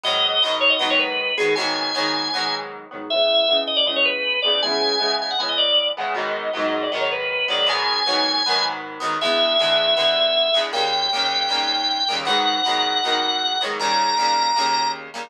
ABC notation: X:1
M:4/4
L:1/16
Q:1/4=157
K:G#m
V:1 name="Drawbar Organ"
d6 c d d c B4 G2 | g12 z4 | e6 d =d ^d c B4 =d2 | g6 g f g d =d4 f2 |
d6 d =d ^d c B4 =d2 | g12 z4 | e16 | =g16 |
f16 | a12 z4 |]
V:2 name="Overdriven Guitar"
[G,,D,F,B,]4 [G,,D,F,B,]4 [G,,D,F,B,]6 [G,,D,F,B,]2 | [G,,D,F,B,]4 [G,,D,F,B,]4 [G,,D,F,B,]6 [G,,D,F,B,]2 | [C,E,G,B,]4 [C,E,G,B,]4 [C,E,G,B,]6 [C,E,G,B,]2 | [C,E,G,B,]4 [C,E,G,B,]4 [C,E,G,B,]6 [C,E,G,B,]2 |
[G,,D,F,B,]4 [G,,D,F,B,]4 [G,,D,F,B,]6 [G,,D,F,B,]2 | [G,,D,F,B,]4 [G,,D,F,B,]4 [G,,D,F,B,]6 [G,,D,F,B,]2 | [E,,=D,G,B,]4 [E,,D,G,B,]4 [E,,D,G,B,]6 [E,,D,G,B,]2 | [D,,C,=G,A,]4 [D,,C,G,A,]4 [D,,C,G,A,]6 [D,,C,G,A,]2 |
[G,,D,F,B,]4 [G,,D,F,B,]4 [G,,D,F,B,]6 [G,,D,F,B,]2 | [D,,C,=G,A,]4 [D,,C,G,A,]4 [D,,C,G,A,]6 [D,,C,G,A,]2 |]